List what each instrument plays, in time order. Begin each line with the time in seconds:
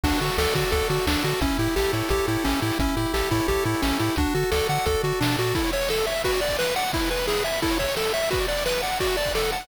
0.04 synth bass 1 D2, lead 1 (square) D4 F#4, kick, crash
0.13 closed hi-hat
0.21 synth bass 1 D3, lead 1 (square) F#4 A4, closed hi-hat
0.29 closed hi-hat
0.38 synth bass 1 D2, lead 1 (square) A4 D5, snare
0.48 closed hi-hat
0.55 synth bass 1 D3, lead 1 (square) F#4 A4, kick, closed hi-hat
0.63 closed hi-hat
0.72 synth bass 1 D2, lead 1 (square) F#4 A4, kick, closed hi-hat
0.81 closed hi-hat
0.90 synth bass 1 D3, lead 1 (square) F#4 A4, closed hi-hat
0.99 closed hi-hat
1.07 synth bass 1 D2, lead 1 (square) D4 D5, snare
1.14 closed hi-hat
1.24 synth bass 1 D3, lead 1 (square) F#4 A4, closed hi-hat
1.32 closed hi-hat
1.41 synth bass 1 A1, lead 1 (square) C#4 E4, kick, closed hi-hat
1.51 closed hi-hat
1.59 synth bass 1 A2, lead 1 (square) E4 G4, closed hi-hat
1.67 closed hi-hat
1.76 synth bass 1 A1, lead 1 (square) G4 A4, snare
1.85 closed hi-hat
1.93 synth bass 1 A2, lead 1 (square) E4 C#5, closed hi-hat
2.03 closed hi-hat
2.09 synth bass 1 A1, lead 1 (square) G4 A4, kick, closed hi-hat
2.18 closed hi-hat
2.27 synth bass 1 A2, lead 1 (square) E4 G4, closed hi-hat
2.36 closed hi-hat
2.44 synth bass 1 A1, lead 1 (square) C#4 E4, snare
2.53 closed hi-hat
2.62 synth bass 1 A2, lead 1 (square) E4 G4, closed hi-hat
2.71 open hi-hat
2.79 synth bass 1 A1, lead 1 (square) C#4 E4, kick, closed hi-hat
2.89 closed hi-hat
2.97 synth bass 1 A2, lead 1 (square) E4 G4, closed hi-hat
3.06 closed hi-hat
3.14 synth bass 1 A1, lead 1 (square) G4 A4, snare
3.21 closed hi-hat
3.31 synth bass 1 A2, lead 1 (square) E4 C#5, kick, closed hi-hat
3.40 closed hi-hat
3.48 synth bass 1 A1, lead 1 (square) G4 A4, kick, closed hi-hat
3.56 closed hi-hat
3.64 synth bass 1 A2, lead 1 (square) E4 G4, closed hi-hat
3.75 closed hi-hat
3.82 synth bass 1 A1, lead 1 (square) C#4 E4, snare
3.91 closed hi-hat
3.99 synth bass 1 A2, lead 1 (square) E4 G4, closed hi-hat
4.10 closed hi-hat
4.16 synth bass 1 D2, lead 1 (square) D4 F#4, kick, closed hi-hat
4.26 closed hi-hat
4.35 synth bass 1 D3, lead 1 (square) F#4 A4, closed hi-hat
4.43 closed hi-hat
4.52 synth bass 1 D2, lead 1 (square) A4 D5, snare
4.59 closed hi-hat
4.69 synth bass 1 D3, lead 1 (square) A4 F#5, closed hi-hat
4.78 closed hi-hat
4.86 synth bass 1 D2, lead 1 (square) F#4 A4, kick, closed hi-hat
4.95 closed hi-hat
5.03 synth bass 1 D3, lead 1 (square) F#4 A4, closed hi-hat
5.13 closed hi-hat
5.20 synth bass 1 B2, lead 1 (square) D4 D5, snare
5.29 closed hi-hat
5.38 synth bass 1 A#2, lead 1 (square) F#4 A4, closed hi-hat
5.46 closed hi-hat
5.55 lead 1 (square) E4 A4, kick, crash
5.64 lead 1 (square) C#5, ride
5.72 lead 1 (square) C#5 E5, ride
5.81 lead 1 (square) C#6, ride
5.89 lead 1 (square) A4 E6, snare
5.97 lead 1 (square) A4, ride
6.06 lead 1 (square) C#5 E5, ride
6.15 lead 1 (square) E5, ride
6.24 lead 1 (square) F#4 B4, kick, ride
6.33 lead 1 (square) D5, ride
6.41 lead 1 (square) D5 F#5, ride
6.48 lead 1 (square) D6, kick, ride
6.59 lead 1 (square) B4 F#6, snare
6.67 lead 1 (square) B4, ride
6.76 lead 1 (square) D5 F#5, ride
6.84 lead 1 (square) F#5, ride
6.93 lead 1 (square) E4, kick, ride
7.02 lead 1 (square) B4, ride
7.09 lead 1 (square) B4 G#5, ride
7.18 lead 1 (square) B5, ride
7.27 lead 1 (square) E4 G#4, snare
7.36 lead 1 (square) B4, ride
7.44 lead 1 (square) E5 G#5, ride
7.53 lead 1 (square) B5, ride
7.62 lead 1 (square) E4 A4, kick, ride
7.71 lead 1 (square) C#5, ride
7.79 lead 1 (square) C#5 E5, kick, ride
7.88 lead 1 (square) C#6, ride
7.96 lead 1 (square) A4 E6, snare
8.05 lead 1 (square) A4, ride
8.14 lead 1 (square) C#5 E5, ride
8.22 lead 1 (square) E5, ride
8.31 lead 1 (square) F#4 B4, kick, ride
8.40 lead 1 (square) D5, ride
8.48 lead 1 (square) D5 F#5, ride
8.57 lead 1 (square) D6, ride
8.66 lead 1 (square) B4 F#6, snare
8.74 lead 1 (square) B4, ride
8.82 lead 1 (square) D5 F#5, ride
8.92 lead 1 (square) F#5, ride
9.00 lead 1 (square) F#4 D5, kick, ride
9.09 lead 1 (square) F#5, ride
9.17 lead 1 (square) D5 A5, ride
9.24 lead 1 (square) F#6, kick, ride
9.35 lead 1 (square) A4 D5, snare
9.43 lead 1 (square) F#5, ride
9.52 lead 1 (square) F#5 A5, ride
9.61 lead 1 (square) F#6, ride